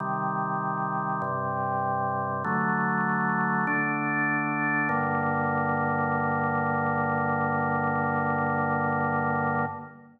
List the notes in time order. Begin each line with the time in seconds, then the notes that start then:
0.00 C3 D#3 G3
1.22 G2 C3 G3
2.44 D3 F#3 A3
3.67 D3 A3 D4
4.89 G2 D3 A#3